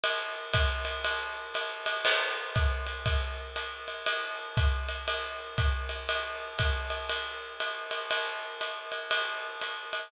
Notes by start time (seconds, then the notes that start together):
0.04 ride
0.53 kick, hi-hat pedal, ride
0.85 ride
1.05 ride
1.54 hi-hat pedal, ride
1.86 ride
2.05 crash, ride
2.55 kick, hi-hat pedal, ride
2.87 ride
3.06 kick, ride
3.56 hi-hat pedal, ride
3.88 ride
4.06 ride
4.57 kick, hi-hat pedal, ride
4.89 ride
5.08 ride
5.58 kick, hi-hat pedal, ride
5.89 ride
6.09 ride
6.59 kick, hi-hat pedal, ride
6.90 ride
7.09 ride
7.60 hi-hat pedal, ride
7.91 ride
8.11 ride
8.61 hi-hat pedal, ride
8.92 ride
9.11 ride
9.61 hi-hat pedal, ride
9.93 ride